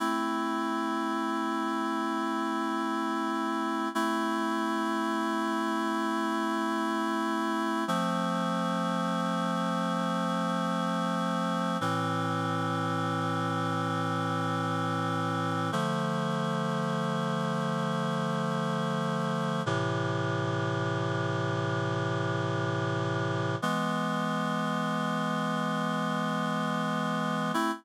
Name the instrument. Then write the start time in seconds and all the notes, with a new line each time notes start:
clarinet
0.00 A3 C4 E4
3.95 A3 C4 E4
7.88 F3 A3 C4
11.81 A2 E3 C4
15.72 D3 F3 A3
19.66 A2 C3 E3
23.62 E3 G#3 B3
27.54 A3 C4 E4